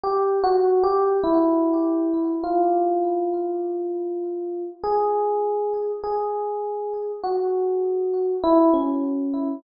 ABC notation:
X:1
M:2/4
L:1/16
Q:1/4=50
K:none
V:1 name="Electric Piano 1"
(3G2 _G2 =G2 E4 | F8 | _A4 A4 | _G4 E _D3 |]